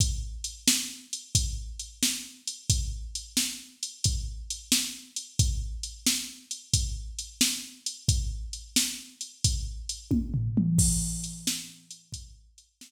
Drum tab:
CC |------------|------------|------------|------------|
HH |x-x--xx-x--x|x-x--xx-x--x|x-x--xx-x--x|x-x--xx-x---|
SD |---o-----o--|---o-----o--|---o-----o--|---o--------|
T1 |------------|------------|------------|---------o--|
T2 |------------|------------|------------|-----------o|
FT |------------|------------|------------|----------o-|
BD |o-----o-----|o-----o-----|o-----o-----|o-----o--o--|

CC |x-----------|
HH |--x--xx-x---|
SD |---o-----o--|
T1 |------------|
T2 |------------|
FT |------------|
BD |o-----o-----|